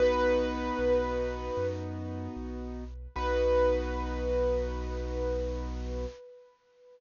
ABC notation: X:1
M:4/4
L:1/8
Q:1/4=76
K:B
V:1 name="Acoustic Grand Piano"
B5 z3 | B8 |]
V:2 name="Acoustic Grand Piano"
[B,DF]8 | [B,DF]8 |]
V:3 name="Acoustic Grand Piano" clef=bass
B,,,2 B,,,2 F,,2 B,,,2 | B,,,8 |]